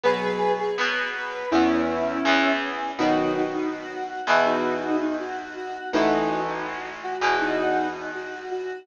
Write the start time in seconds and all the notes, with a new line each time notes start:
0.04 B2 F#3 B3 G#4 B4
0.59 G#4
0.78 B2 F#3 B3 B4
1.14 B4
1.51 E2 E3 B3 C#4 E4
2.25 E2 E3 B3
2.98 B2 D#3 F#3 D#4 F#4
3.53 D#4
3.71 F#4
4.09 F#4
4.27 E2 B2 E3
4.45 D#4 F#4
5.01 D#4
5.19 F#4
5.56 F#4
5.93 A1 A2 E3 D#4 F#4
6.48 D#4
6.66 F#4
7.03 F#4
7.21 E2 B2 E3
7.40 D#4 F#4
7.95 D#4
8.14 F#4
8.51 F#4